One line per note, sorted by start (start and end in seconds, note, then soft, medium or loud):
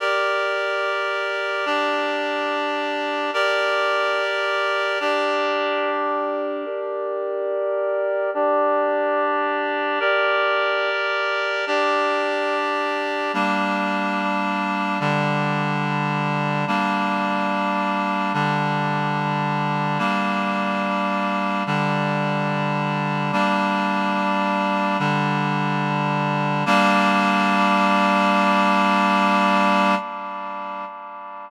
0.00 1.65 G4 medium
0.00 1.65 A#4 medium
0.00 1.65 D5 medium
1.66 3.31 D4 medium
1.66 3.31 G4 medium
1.66 3.31 D5 medium
3.34 4.99 G4 medium
3.34 4.99 A#4 medium
3.34 4.99 D5 medium
5.00 6.65 D4 medium
5.00 6.65 G4 medium
5.00 6.65 D5 medium
6.66 8.30 G4 medium
6.66 8.30 A#4 medium
6.66 8.30 D5 medium
8.34 9.99 D4 medium
8.34 9.99 G4 medium
8.34 9.99 D5 medium
10.00 11.65 G4 medium
10.00 11.65 A#4 medium
10.00 11.65 D5 medium
11.67 13.32 D4 medium
11.67 13.32 G4 medium
11.67 13.32 D5 medium
13.34 14.99 G3 medium
13.34 14.99 A#3 medium
13.34 14.99 D4 medium
15.00 16.65 D3 medium
15.00 16.65 G3 medium
15.00 16.65 D4 medium
16.67 18.32 G3 medium
16.67 18.32 A#3 medium
16.67 18.32 D4 medium
18.34 19.99 D3 medium
18.34 19.98 G3 medium
18.34 19.98 D4 medium
19.98 21.63 G3 medium
19.98 21.63 A#3 medium
19.98 21.63 D4 medium
21.66 23.31 D3 medium
21.66 23.31 G3 medium
21.66 23.31 D4 medium
23.32 24.97 G3 medium
23.32 24.97 A#3 medium
23.32 24.97 D4 medium
24.99 26.64 D3 medium
24.99 26.64 G3 medium
24.99 26.64 D4 medium
26.66 29.95 G3 loud
26.66 29.95 A#3 loud
26.66 29.95 D4 medium